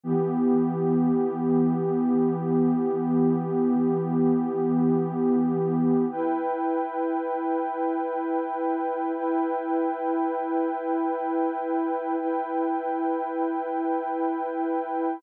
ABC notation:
X:1
M:4/4
L:1/8
Q:1/4=79
K:Edor
V:1 name="Pad 2 (warm)"
[E,B,G]8- | [E,B,G]8 | [EBg]8 | [EBg]8 |
[EBg]8 |]